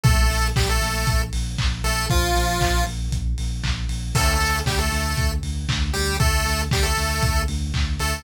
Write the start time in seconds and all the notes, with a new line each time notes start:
0.04 A#1 A3 A4, kick, closed hi-hat
0.30 A#1, open hi-hat
0.56 A#1 G3 G4, kick, clap
0.69 A3 A4
0.82 A#1, open hi-hat
1.07 A#1, kick, closed hi-hat
1.33 A#1, open hi-hat
1.58 A#1, kick, clap
1.84 A#1 A3 A4, open hi-hat
2.10 A#1 F3 F4, kick, closed hi-hat
2.35 A#1, open hi-hat
2.61 A#1, kick, clap
2.86 A#1, open hi-hat
3.11 A#1, kick, closed hi-hat
3.38 A#1, open hi-hat
3.63 A#1, kick, clap
3.89 A#1, open hi-hat
4.15 D2 A3 A4, kick, crash
4.40 D2, open hi-hat
4.66 D2 G3 G4, kick, clap
4.79 A3 A4
4.92 D2, open hi-hat
5.17 D2, kick, closed hi-hat
5.43 D2, open hi-hat
5.69 D2, kick, clap
5.93 D2 G3 G4, open hi-hat
6.20 D2 A3 A4, kick, closed hi-hat
6.46 D2, open hi-hat
6.71 D2 G3 G4, kick, clap
6.83 A3 A4
6.97 D2, open hi-hat
7.23 D2, kick, closed hi-hat
7.48 D2, open hi-hat
7.74 D2, kick, clap
7.99 D2 A3 A4, open hi-hat